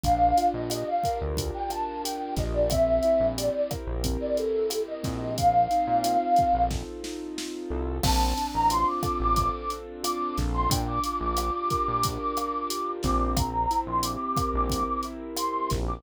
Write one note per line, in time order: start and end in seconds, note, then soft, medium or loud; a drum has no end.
0.03 0.33 A#1 medium
0.03 1.37 D4 medium
0.03 0.45 F5 medium
0.03 kick medium
0.03 closed hi-hat medium
0.37 1.69 F4 medium
0.37 closed hi-hat medium
0.54 0.84 A#1 medium
0.54 0.70 D#5 medium
0.70 2.03 G4 medium
0.70 0.86 D#5 medium
0.70 cross-stick medium
0.70 closed hi-hat medium
0.87 1.15 F5 medium
1.03 2.37 A#4 medium
1.03 kick medium
1.03 closed hi-hat medium
1.21 1.51 D2 medium
1.37 2.64 D4 medium
1.37 kick medium
1.37 closed hi-hat medium
1.54 1.70 G5 medium
1.70 2.65 F4 medium
1.70 2.01 A5 medium
1.70 cross-stick medium
1.70 closed hi-hat medium
2.04 2.67 G4 medium
2.04 2.32 G5 medium
2.04 closed hi-hat loud
2.36 3.00 A#1 medium
2.36 2.69 A#4 medium
2.36 2.53 D#5 medium
2.36 kick medium
2.36 snare soft
2.36 closed hi-hat medium
2.54 2.70 D5 medium
2.70 4.04 C4 medium
2.70 3.26 E5 medium
2.70 kick medium
2.70 cross-stick medium
2.70 closed hi-hat medium
3.03 4.36 E4 medium
3.03 closed hi-hat medium
3.20 3.50 A#1 medium
3.37 4.71 G4 medium
3.37 3.53 D5 medium
3.37 closed hi-hat medium
3.54 3.69 D5 medium
3.71 5.29 A#4 medium
3.71 kick medium
3.71 cross-stick medium
3.71 closed hi-hat medium
3.87 4.17 A#1 medium
4.04 5.03 C4 medium
4.04 kick medium
4.04 closed hi-hat medium
4.20 4.36 D5 medium
4.37 5.32 E4 medium
4.37 4.79 A4 medium
4.37 closed hi-hat medium
4.70 5.34 G4 medium
4.70 cross-stick medium
4.70 closed hi-hat medium
4.87 5.31 D#5 medium
5.03 5.68 A#1 medium
5.03 6.70 C4 medium
5.03 kick medium
5.03 snare soft
5.03 closed hi-hat medium
5.38 6.62 F5 medium
5.38 kick medium
5.38 closed hi-hat medium
5.71 7.03 D#4 medium
5.71 closed hi-hat medium
5.87 6.17 A#2 medium
6.03 7.37 F4 medium
6.03 cross-stick medium
6.03 closed hi-hat medium
6.36 7.70 A4 soft
6.36 kick medium
6.36 closed hi-hat medium
6.53 6.83 A#1 medium
6.71 7.97 C4 soft
6.71 kick medium
6.71 snare medium
7.04 7.99 D#4 medium
7.04 snare medium
7.37 8.00 F4 medium
7.37 snare medium
7.70 8.00 C2 medium
7.70 8.02 A4 medium
8.03 8.34 A#1 loud
8.03 9.36 C4 medium
8.03 8.47 A5 medium
8.03 kick medium
8.03 cross-stick loud
8.03 crash loud
8.37 9.71 D4 medium
8.37 closed hi-hat medium
8.54 8.84 A1 medium
8.54 8.70 A#5 medium
8.70 10.03 F4 medium
8.70 8.86 C6 medium
8.70 closed hi-hat medium
8.87 9.15 D6 medium
9.03 10.37 A4 medium
9.03 kick medium
9.03 cross-stick medium
9.03 closed hi-hat medium
9.20 9.50 A1 medium
9.20 9.52 D6 medium
9.36 10.63 C4 medium
9.36 kick medium
9.36 closed hi-hat medium
9.54 9.70 D6 medium
9.70 10.66 D4 medium
9.70 closed hi-hat medium
10.03 10.67 F4 medium
10.03 10.34 D6 medium
10.03 cross-stick medium
10.03 closed hi-hat loud
10.38 10.68 A#1 medium
10.38 10.69 A4 medium
10.38 kick medium
10.38 snare medium
10.38 closed hi-hat medium
10.54 10.69 C6 medium
10.69 10.99 A#1 loud
10.69 12.04 D4 medium
10.69 10.86 G5 medium
10.69 kick medium
10.69 closed hi-hat loud
10.87 11.17 D6 medium
11.03 12.37 F4 medium
11.03 closed hi-hat medium
11.21 11.51 A#1 medium
11.21 11.37 D6 medium
11.37 12.69 G4 medium
11.37 11.53 D6 medium
11.37 cross-stick medium
11.37 closed hi-hat medium
11.54 11.87 D6 medium
11.70 13.29 A#4 medium
11.70 kick medium
11.70 closed hi-hat medium
11.87 12.18 A#1 medium
11.87 12.19 D6 medium
12.03 13.31 D4 medium
12.03 kick medium
12.03 closed hi-hat loud
12.21 12.88 D6 medium
12.37 13.32 F4 medium
12.37 cross-stick medium
12.37 closed hi-hat medium
12.70 13.33 G4 medium
12.70 closed hi-hat loud
13.03 13.67 A#1 loud
13.03 14.71 C4 medium
13.03 13.33 D6 medium
13.03 kick medium
13.03 snare medium
13.03 closed hi-hat medium
13.37 13.78 A#5 medium
13.37 kick medium
13.37 cross-stick medium
13.37 closed hi-hat loud
13.71 15.04 E4 medium
13.71 closed hi-hat medium
13.87 14.17 A#1 medium
13.87 14.03 C6 medium
14.03 15.37 G4 medium
14.03 14.19 D6 medium
14.03 closed hi-hat loud
14.20 14.49 D6 medium
14.37 15.71 A#4 medium
14.37 kick medium
14.37 cross-stick medium
14.37 closed hi-hat medium
14.54 14.84 A#1 medium
14.54 14.84 D6 medium
14.69 15.98 C4 medium
14.69 kick medium
14.69 closed hi-hat medium
14.87 15.03 D6 medium
15.03 15.99 E4 medium
15.03 closed hi-hat medium
15.37 16.00 G4 medium
15.37 15.69 C6 medium
15.37 cross-stick medium
15.37 closed hi-hat loud
15.70 16.02 A#1 medium
15.70 16.03 A#4 medium
15.70 kick medium
15.70 snare medium
15.70 closed hi-hat medium
15.88 16.03 D6 medium